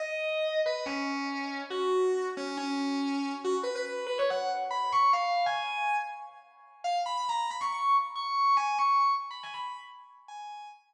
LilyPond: \new Staff { \time 4/4 \key gis \minor \tempo 4 = 140 dis''4. b'8 cis'2 | fis'4. cis'8 cis'2 | fis'16 r16 b'16 b'16 b'8 b'16 cis''16 fis''8 r8 b''8 cis'''8 | eis''8. gis''4~ gis''16 r2 |
eis''16 r16 b''16 b''16 ais''8 b''16 cis'''16 cis'''8 r8 cis'''8 cis'''8 | gis''8 cis'''8 cis'''16 r8 b''16 gis''16 b''8 r4 r16 | gis''4 r2. | }